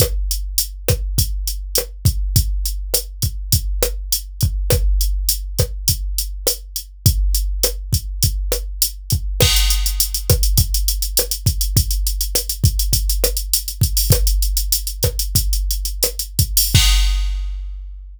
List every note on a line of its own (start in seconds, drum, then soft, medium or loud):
0.00 kick medium
0.00 cross-stick loud
0.00 closed hi-hat loud
0.31 closed hi-hat medium
0.58 closed hi-hat loud
0.88 kick medium
0.88 cross-stick loud
0.88 closed hi-hat medium
1.18 kick medium
1.18 closed hi-hat loud
1.47 closed hi-hat medium
1.75 cross-stick medium
1.75 closed hi-hat loud
2.05 kick medium
2.05 closed hi-hat medium
2.36 kick loud
2.36 closed hi-hat loud
2.66 closed hi-hat medium
2.94 cross-stick medium
2.94 closed hi-hat loud
3.22 kick medium
3.22 closed hi-hat medium
3.52 kick medium
3.52 closed hi-hat loud
3.83 cross-stick loud
3.83 closed hi-hat medium
4.12 closed hi-hat loud
4.41 kick medium
4.41 closed hi-hat medium
4.70 kick loud
4.70 cross-stick loud
4.70 closed hi-hat loud
5.01 closed hi-hat medium
5.29 closed hi-hat loud
5.59 kick medium
5.59 cross-stick medium
5.59 closed hi-hat medium
5.88 kick medium
5.88 closed hi-hat loud
6.18 closed hi-hat medium
6.47 cross-stick medium
6.47 closed hi-hat loud
6.76 closed hi-hat medium
7.06 kick loud
7.06 closed hi-hat loud
7.35 closed hi-hat medium
7.63 cross-stick medium
7.63 closed hi-hat loud
7.93 kick medium
7.93 closed hi-hat medium
8.23 kick medium
8.23 closed hi-hat loud
8.52 cross-stick medium
8.52 closed hi-hat medium
8.82 closed hi-hat loud
9.10 kick medium
9.10 closed hi-hat medium
9.40 kick loud
9.40 cross-stick loud
9.40 crash loud
9.56 closed hi-hat medium
9.70 closed hi-hat medium
9.86 closed hi-hat medium
10.00 closed hi-hat loud
10.14 closed hi-hat medium
10.30 kick loud
10.30 cross-stick loud
10.30 closed hi-hat medium
10.43 closed hi-hat medium
10.57 kick loud
10.57 closed hi-hat loud
10.74 closed hi-hat medium
10.88 closed hi-hat medium
11.02 closed hi-hat medium
11.17 cross-stick medium
11.17 closed hi-hat loud
11.31 closed hi-hat medium
11.46 kick medium
11.46 closed hi-hat medium
11.61 closed hi-hat medium
11.77 kick loud
11.77 closed hi-hat loud
11.91 closed hi-hat medium
12.07 closed hi-hat medium
12.21 closed hi-hat medium
12.35 cross-stick medium
12.35 closed hi-hat loud
12.49 closed hi-hat medium
12.64 kick medium
12.64 closed hi-hat medium
12.79 closed hi-hat medium
12.93 kick medium
12.93 closed hi-hat loud
13.10 closed hi-hat medium
13.24 cross-stick medium
13.24 closed hi-hat medium
13.37 closed hi-hat medium
13.53 closed hi-hat loud
13.68 closed hi-hat medium
13.81 kick medium
13.81 closed hi-hat medium
13.97 open hi-hat medium
14.10 kick loud
14.10 cross-stick loud
14.10 closed hi-hat loud
14.27 closed hi-hat medium
14.42 closed hi-hat medium
14.57 closed hi-hat medium
14.72 closed hi-hat loud
14.87 closed hi-hat medium
15.03 kick medium
15.03 cross-stick loud
15.03 closed hi-hat medium
15.19 closed hi-hat medium
15.35 kick medium
15.35 closed hi-hat loud
15.53 closed hi-hat medium
15.71 closed hi-hat medium
15.85 closed hi-hat medium
16.03 cross-stick medium
16.03 closed hi-hat loud
16.19 closed hi-hat medium
16.39 kick medium
16.39 closed hi-hat medium
16.57 open hi-hat medium
16.75 kick loud
16.75 crash loud